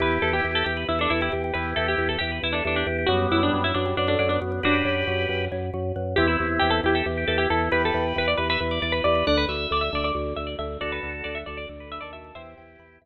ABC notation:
X:1
M:7/8
L:1/16
Q:1/4=136
K:Em
V:1 name="Pizzicato Strings"
B2 A G2 A G2 E D E E z2 | B2 A G2 A G2 E D D D z2 | F2 E D2 E D2 D D D D z2 | [DF]10 z4 |
G E2 z G A G G3 A G A2 | B A2 z B d B B3 d B d2 | d B2 z d e d d3 e d e2 | d B2 z d e d d3 e d e2 |
[ce]6 z8 |]
V:2 name="Drawbar Organ"
[EG]6 G B z A A G G G | [EG]6 G B z A A G G G | [G,B,]6 B, G, z A, A, B, B, B, | [GB]8 z6 |
[CE]6 E A z G G E E E | [GB]6 B e z d d B B B | f2 e6 z6 | [FA]6 A d z B B A A A |
[EG]6 z8 |]
V:3 name="Xylophone"
G2 B2 e2 G2 B2 e2 G2 | B2 e2 G2 B2 e2 G2 B2 | F2 B2 ^c2 F2 B2 c2 F2 | B2 ^c2 F2 B2 c2 F2 B2 |
E2 G2 B2 E2 G2 B2 E2 | G2 B2 E2 G2 B2 E2 G2 | D2 F2 A2 D2 F2 A2 D2 | F2 A2 D2 F2 A2 D2 F2 |
e2 g2 b2 e2 z6 |]
V:4 name="Drawbar Organ" clef=bass
E,,2 E,,2 E,,2 E,,2 E,,2 E,,2 E,,2 | E,,2 E,,2 E,,2 E,,2 E,,2 E,,2 E,,2 | F,,2 F,,2 F,,2 F,,2 F,,2 F,,2 F,,2 | F,,2 F,,2 F,,2 F,,2 F,,2 F,,2 F,,2 |
E,,2 E,,2 E,,2 E,,2 E,,2 E,,2 E,,2 | E,,2 E,,2 E,,2 E,,2 E,,2 E,,2 E,,2 | D,,2 D,,2 D,,2 D,,2 D,,2 D,,2 D,,2 | D,,2 D,,2 D,,2 D,,2 D,,3 ^D,,3 |
E,,2 E,,2 E,,2 E,,2 z6 |]